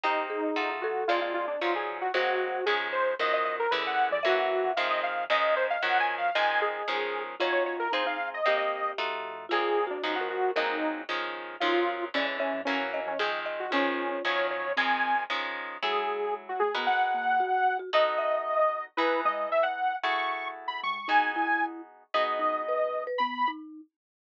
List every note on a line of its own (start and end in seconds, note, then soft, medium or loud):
0.03 0.52 C2 medium
0.03 0.51 A#3 loud
0.03 0.51 C4 loud
0.03 0.51 D#4 loud
0.03 0.70 D#4 loud
0.03 0.51 G4 loud
0.03 0.27 G4 medium
0.30 0.78 G#4 medium
0.56 1.05 F2 medium
0.56 1.04 A3 loud
0.56 1.04 D#4 loud
0.56 1.04 F4 loud
0.56 1.04 F#4 loud
0.82 1.04 F#4 medium
0.82 1.08 A4 loud
1.08 1.57 A#1 medium
1.08 1.56 G#3 loud
1.08 1.56 A#3 loud
1.08 1.56 C4 loud
1.08 1.56 D4 loud
1.08 1.20 F4 medium
1.08 2.06 D5 medium
1.21 1.33 F4 medium
1.34 1.46 F4 medium
1.48 1.60 D4 medium
1.61 2.10 D#2 loud
1.61 2.09 F3 loud
1.61 2.09 F#3 loud
1.61 2.09 C#4 loud
1.61 2.09 D#4 loud
1.61 1.74 F4 medium
1.75 1.98 G#4 medium
2.01 2.12 F#4 medium
2.14 2.62 G#1 loud
2.14 2.61 F#3 loud
2.14 2.61 G#3 loud
2.14 2.61 A#3 loud
2.14 2.61 C4 loud
2.14 2.65 F#4 medium
2.14 2.65 C5 medium
2.66 3.15 C#2 loud
2.66 3.14 D#3 loud
2.66 3.14 F3 loud
2.66 3.14 G#3 loud
2.66 3.14 C#4 loud
2.66 2.88 G#4 medium
2.93 3.15 C5 medium
3.19 3.67 D#2 loud
3.19 3.67 D#3 loud
3.19 3.67 F3 loud
3.19 3.67 F#3 loud
3.19 3.67 C#4 loud
3.19 4.09 A#4 medium
3.19 3.33 D#5 medium
3.33 3.44 D#5 medium
3.45 3.56 D#5 medium
3.60 3.71 A#4 medium
3.71 4.09 E2 medium
3.71 4.19 D3 loud
3.71 4.19 E3 loud
3.71 4.19 G#3 loud
3.71 4.19 C#4 loud
3.71 3.83 B4 medium
3.87 4.09 F#5 medium
4.11 4.61 F#2 loud
4.11 4.24 D5 medium
4.23 4.72 E3 loud
4.23 4.72 F#3 loud
4.23 4.72 A#3 loud
4.23 4.72 C#4 loud
4.23 4.72 F#4 loud
4.23 5.07 E5 loud
4.64 5.26 F2 loud
4.76 5.25 D#3 loud
4.76 5.25 F3 loud
4.76 5.25 G#3 loud
4.76 5.25 C4 loud
4.76 4.88 F5 medium
4.90 5.02 D#5 medium
5.03 5.25 F5 medium
5.30 5.78 C#2 loud
5.30 5.77 D#3 loud
5.30 5.77 F3 loud
5.30 5.77 G#3 loud
5.30 5.77 C#4 loud
5.30 5.55 D#5 loud
5.30 6.21 D#5 medium
5.56 5.67 C5 medium
5.70 5.82 F5 medium
5.82 6.31 F#2 loud
5.82 6.30 D#3 loud
5.82 6.30 F3 loud
5.82 6.30 F#3 loud
5.82 6.30 C#4 loud
5.82 5.98 F#5 medium
6.00 6.15 G#5 medium
6.18 6.35 F5 medium
6.35 6.83 D#3 loud
6.35 6.83 F3 loud
6.35 6.83 G#3 loud
6.35 6.83 C4 loud
6.35 6.88 D#5 loud
6.35 6.60 G#5 loud
6.62 7.23 G#4 medium
6.88 7.35 D#3 loud
6.88 7.35 F3 loud
6.88 7.35 G#3 loud
6.88 7.35 C#4 loud
7.39 7.89 D#2 loud
7.39 7.88 C#4 loud
7.39 7.88 D#4 loud
7.39 7.87 F4 loud
7.39 7.88 F4 loud
7.39 7.88 F#4 loud
7.39 7.52 C#5 loud
7.52 7.64 C#5 medium
7.66 7.77 C#5 medium
7.79 7.92 A#4 medium
7.92 8.41 G#1 loud
7.92 8.40 C4 loud
7.92 8.03 D#4 medium
7.92 8.40 D#4 loud
7.92 8.40 F4 loud
7.92 8.40 G#4 loud
7.92 8.06 C5 medium
8.06 8.17 D#4 medium
8.06 8.29 F5 medium
8.34 8.45 D#5 medium
8.46 8.94 C2 medium
8.46 8.93 A#3 loud
8.46 8.93 C4 loud
8.46 8.93 D#4 loud
8.46 8.93 G4 loud
8.46 9.37 G4 loud
8.46 8.58 D#5 medium
8.59 8.91 D#5 medium
8.98 9.47 F2 medium
8.98 9.46 A3 loud
8.98 9.46 D#4 loud
8.98 9.46 F4 loud
8.98 9.46 F#4 loud
9.49 10.00 A#1 medium
9.49 9.98 G#3 loud
9.49 9.98 A#3 loud
9.49 9.98 C4 loud
9.49 9.98 D4 loud
9.49 9.79 F4 medium
9.49 9.85 G#4 loud
9.87 10.02 D4 medium
9.87 10.17 F#4 medium
10.03 10.52 D#2 loud
10.03 10.51 F3 loud
10.03 10.51 F#3 loud
10.03 10.51 C#4 loud
10.03 10.15 D#4 medium
10.03 10.51 D#4 loud
10.16 10.28 F#4 medium
10.20 10.53 A#4 medium
10.30 10.51 F#4 medium
10.56 11.05 G#1 loud
10.56 11.04 F#3 loud
10.56 11.04 G#3 loud
10.56 11.04 A#3 loud
10.56 11.04 C4 loud
10.56 11.01 D#4 loud
10.56 10.77 A#4 loud
11.09 11.57 C#2 loud
11.09 11.56 D#3 loud
11.09 11.56 F3 loud
11.09 11.56 G#3 loud
11.09 11.56 C#4 loud
11.60 12.10 D#2 loud
11.60 12.09 D#3 loud
11.60 12.09 F3 loud
11.60 12.09 F#3 loud
11.60 12.09 C#4 loud
11.60 11.74 D#4 loud
11.60 12.04 F4 loud
12.14 12.52 E2 medium
12.14 12.61 D3 loud
12.14 12.61 E3 loud
12.14 12.61 G#3 loud
12.14 12.61 C#4 loud
12.14 12.38 C#4 medium
12.14 12.26 D5 medium
12.39 12.61 C#4 medium
12.39 12.61 E5 medium
12.54 13.04 F#2 loud
12.65 13.14 E3 loud
12.65 13.14 F#3 loud
12.65 13.14 A#3 loud
12.65 13.00 C#4 medium
12.65 13.14 C#4 loud
12.65 12.88 C#5 loud
12.93 13.39 D#5 medium
13.06 13.68 F2 loud
13.06 13.18 C#4 medium
13.19 13.67 D#3 loud
13.19 13.67 F3 loud
13.19 13.67 G#3 loud
13.19 13.67 C4 loud
13.19 13.31 G#4 medium
13.46 13.70 D#5 medium
13.60 13.71 F#4 medium
13.71 14.21 C#2 loud
13.71 14.19 D#3 loud
13.71 14.19 F3 loud
13.71 14.19 G#3 loud
13.71 14.19 C#4 loud
13.71 14.23 C#4 loud
13.71 14.66 F4 medium
14.25 14.73 F#2 loud
14.25 14.72 D#3 loud
14.25 14.72 F3 loud
14.25 14.72 F#3 loud
14.25 14.72 C#4 loud
14.25 14.47 C#5 medium
14.50 14.73 C#5 medium
14.76 15.25 D#3 loud
14.76 15.25 F3 loud
14.76 15.25 G#3 loud
14.76 15.14 C4 medium
14.76 15.25 C4 loud
14.76 15.23 G#5 medium
15.30 15.77 D#3 loud
15.30 15.77 F3 loud
15.30 15.77 G#3 loud
15.30 15.77 C#4 loud
15.82 16.70 F#3 loud
15.82 16.53 G#3 loud
15.82 16.70 E4 loud
15.82 16.70 G#4 loud
15.82 16.34 G#4 medium
15.82 16.70 A4 loud
16.49 16.61 F#4 medium
16.60 16.74 A3 medium
16.60 16.83 G#4 medium
16.75 17.82 G#3 loud
16.75 16.87 B3 medium
16.75 17.82 F#4 loud
16.75 17.82 A#4 loud
16.75 17.82 B4 loud
16.87 17.77 F#5 loud
17.14 17.39 A#3 medium
17.40 17.78 F#4 medium
17.79 17.90 F#4 medium
17.93 18.88 B3 loud
17.93 18.88 D#4 loud
17.93 18.88 F#4 loud
17.93 18.88 A4 loud
17.93 18.85 D#5 medium
17.93 18.18 D#5 medium
18.18 18.61 E5 medium
18.97 19.93 E3 loud
18.97 19.93 D#4 loud
18.97 19.21 E4 loud
18.97 19.93 G#4 loud
18.97 19.21 B4 loud
18.97 19.93 B4 loud
19.25 19.46 G#3 medium
19.25 19.49 D#5 medium
19.52 19.64 E5 medium
19.63 19.96 F#5 medium
20.03 20.98 A3 loud
20.03 20.98 E4 loud
20.03 20.98 F#4 loud
20.03 20.98 G#4 loud
20.03 20.48 C#6 medium
20.68 20.80 B5 medium
20.83 21.06 G#3 medium
20.83 21.08 C#6 medium
21.08 22.03 B3 loud
21.08 21.31 D#4 loud
21.08 22.03 D#4 loud
21.08 22.03 F#4 loud
21.08 22.03 G#4 loud
21.08 21.66 G#5 medium
21.36 21.81 E4 medium
22.14 23.09 B3 loud
22.14 23.09 D#4 loud
22.14 23.09 F#4 medium
22.14 23.09 G#4 loud
22.14 23.04 D#5 medium
22.39 22.62 D#4 medium
22.68 23.02 B4 medium
23.07 23.18 B4 medium
23.18 23.44 B3 loud
23.18 23.50 B5 medium
23.48 23.81 D#4 medium